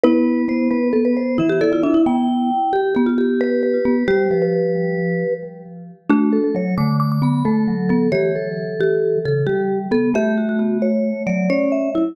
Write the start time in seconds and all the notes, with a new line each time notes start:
0.04 B3 E4 B4
0.48 B3 C5
0.71 B3 B4
0.93 B3 A4
1.05 B4
1.17 C5
1.38 E3 E4 E5
1.49 G4
1.61 E4 A4 D5
1.72 F4 D5
1.83 D4 E4 E5
1.94 E4
2.06 B3 G5
2.73 G4
2.95 B3 G4
3.06 F4
3.18 G4
3.41 B4
3.63 B4
3.85 B3
4.08 G3 G4 C5
4.31 F3 B4
4.42 B4
6.10 A3 D4 F#4
6.33 A4
6.44 A4
6.55 F#3 C#5
6.78 D3 A3 D6
7.00 D6
7.12 D6
7.22 B3 B5
7.45 A3 A4
7.68 F#3
7.89 B3 A4
8.12 E3 G4 C#5
8.35 A4
8.81 G4
9.25 C#3 A4
9.47 G3 G4
9.91 B3 A4
10.14 A3 G4 E5
10.38 F#4
10.49 F#4
10.59 F#4
10.82 C#5
11.27 F#3 D5
11.50 C#4 C#5
11.72 E5
11.95 E4